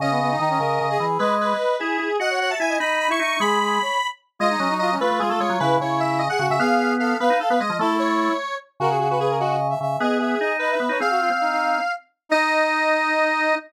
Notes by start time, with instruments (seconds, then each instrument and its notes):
0.00 drawbar organ C#3, brass section C#4, lead 1 (square) D#5
0.11 brass section B3
0.21 brass section B3
0.30 brass section D#4
0.40 drawbar organ D#3, brass section D#4
0.49 brass section C#4
0.59 drawbar organ C#3, brass section A#4
0.81 drawbar organ C#3
0.90 brass section G#4
0.99 drawbar organ E3, brass section G#4
1.19 drawbar organ G#3, lead 1 (square) B4, brass section D#5
1.41 lead 1 (square) B4
1.79 drawbar organ E4, lead 1 (square) G#4
1.99 drawbar organ E4
2.20 drawbar organ F#4, brass section D#5, lead 1 (square) F#5
2.30 brass section C#5
2.40 brass section C#5, lead 1 (square) F#5
2.50 brass section E5, lead 1 (square) A5
2.60 drawbar organ E4, brass section E5, lead 1 (square) G#5
2.69 brass section D#5
2.80 drawbar organ D#4, brass section D#5, lead 1 (square) B5
3.00 lead 1 (square) B5
3.09 drawbar organ E4, brass section E5, lead 1 (square) C#6
3.20 drawbar organ D#4, brass section E5, lead 1 (square) C#6
3.40 drawbar organ G#3, brass section G#4, lead 1 (square) B5
3.60 brass section G#4
3.82 brass section C#5
4.39 drawbar organ G#3, brass section F4, lead 1 (square) D#5
4.50 brass section D#4
4.59 drawbar organ F#3, brass section C#4
4.70 brass section D#4
4.79 brass section F4, lead 1 (square) D#5
4.91 brass section C#4
5.00 drawbar organ A3, brass section F4, lead 1 (square) B4
5.11 drawbar organ A3
5.19 drawbar organ G#3, brass section F4, lead 1 (square) G#4
5.29 drawbar organ A3, lead 1 (square) A4
5.40 drawbar organ G#3, lead 1 (square) C#5
5.50 drawbar organ F#3
5.60 drawbar organ C#3, brass section E4, lead 1 (square) B4
5.79 drawbar organ C#3, brass section E4, lead 1 (square) C#5
6.00 lead 1 (square) E5
6.19 lead 1 (square) D#5
6.29 brass section G#4, lead 1 (square) F#5
6.39 drawbar organ C#3, brass section F#4
6.50 drawbar organ C#3, lead 1 (square) E5
6.60 drawbar organ B3, brass section G#4, lead 1 (square) F5
6.99 brass section A4, lead 1 (square) F5
7.20 drawbar organ B3, lead 1 (square) B4, brass section F5
7.30 drawbar organ D#4
7.40 lead 1 (square) A4, brass section F5
7.50 drawbar organ B3, lead 1 (square) B4
7.60 drawbar organ G#3, brass section D#5, lead 1 (square) D#5
7.70 drawbar organ F3
7.79 drawbar organ A3, brass section E4, lead 1 (square) A4
7.99 lead 1 (square) C#5
8.80 drawbar organ C#3, lead 1 (square) F#4, brass section A#4
8.89 brass section G#4
8.99 lead 1 (square) F#4, brass section G#4
9.10 lead 1 (square) F#4, brass section B4
9.19 lead 1 (square) G#4, brass section B4
9.29 brass section A#4
9.39 lead 1 (square) F#4, brass section D#5
9.70 brass section E5
9.81 drawbar organ C#3, brass section E5
10.00 drawbar organ B3, lead 1 (square) G#4, brass section D#5
10.19 lead 1 (square) G#4, brass section E5
10.40 drawbar organ D#4, brass section D#5
10.59 lead 1 (square) B4, brass section D#5
10.70 brass section E5
10.80 drawbar organ B3
10.89 drawbar organ D#4, brass section C#5
10.99 drawbar organ C4, brass section G#4, lead 1 (square) F5
11.10 brass section F#4
11.20 brass section F4
11.30 drawbar organ C4
11.41 brass section D#4
11.51 brass section D#4
12.29 brass section D#4, drawbar organ D#4, lead 1 (square) D#5